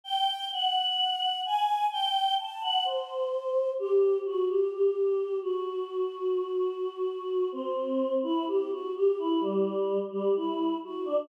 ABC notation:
X:1
M:4/4
L:1/16
Q:1/4=64
K:G
V:1 name="Choir Aahs"
g2 f4 _a2 g2 =a f c4 | G2 F G G3 F9 | C3 E G F G E G,3 G, E2 F D |]